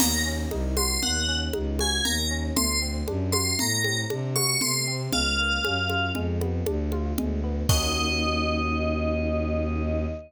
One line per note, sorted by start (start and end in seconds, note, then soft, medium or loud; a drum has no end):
0.00 0.46 D#2 medium
0.00 0.23 A#3 medium
0.00 0.24 A#5 loud
0.00 crash loud
0.00 low conga loud
0.26 0.49 C#4 medium
0.51 0.97 C2 medium
0.51 0.74 D#4 medium
0.51 high conga medium
0.77 1.00 F#4 medium
0.77 1.00 C6 medium
0.77 high conga medium
1.03 1.49 D#2 medium
1.03 1.26 A#3 medium
1.03 1.35 F#5 medium
1.03 low conga medium
1.28 1.51 C#4 medium
1.53 2.00 C#2 medium
1.53 1.77 D#4 medium
1.53 high conga medium
1.79 2.03 F#4 medium
1.79 2.05 G#5 medium
1.79 high conga medium
2.04 2.51 D#2 medium
2.04 2.28 A#3 medium
2.04 2.28 A#5 medium
2.04 low conga medium
2.31 2.54 C#4 medium
2.56 3.02 D2 medium
2.56 2.79 A3 medium
2.56 2.80 C6 loud
2.56 low conga loud
2.82 3.05 C4 medium
3.08 3.54 F#2 medium
3.08 3.31 D4 medium
3.08 high conga medium
3.32 3.56 F#4 medium
3.32 3.54 C6 medium
3.32 high conga medium
3.59 4.05 A2 medium
3.59 3.82 A3 medium
3.59 3.96 A#5 loud
3.59 low conga loud
3.84 4.08 C4 medium
3.84 high conga medium
4.10 4.56 C3 medium
4.10 4.33 D4 medium
4.10 high conga medium
4.36 4.59 F#4 medium
4.36 4.59 C#6 loud
4.36 high conga medium
4.61 5.08 C3 medium
4.61 4.85 A3 medium
4.61 4.86 C6 medium
4.61 low conga medium
4.87 5.10 C4 medium
5.13 5.59 C#2 medium
5.13 5.36 G#3 medium
5.13 6.08 F5 medium
5.13 low conga loud
5.38 5.62 A#3 medium
5.64 6.11 F#2 medium
5.64 5.87 C#4 medium
5.64 high conga medium
5.90 6.13 F4 medium
5.90 high conga medium
6.15 6.61 F2 medium
6.15 6.39 G#3 loud
6.15 low conga medium
6.41 6.64 B3 medium
6.41 high conga medium
6.66 7.13 D2 medium
6.66 6.90 D4 medium
6.66 high conga loud
6.92 7.15 F4 medium
6.92 high conga medium
7.17 7.63 D2 medium
7.17 7.41 G#3 medium
7.17 low conga loud
7.44 7.67 B3 medium
7.69 10.06 D#2 loud
7.69 10.06 A#3 loud
7.69 10.06 C#4 medium
7.69 10.06 D#4 loud
7.69 10.06 F#4 loud
7.69 10.06 D#5 loud
7.69 kick loud
7.69 crash loud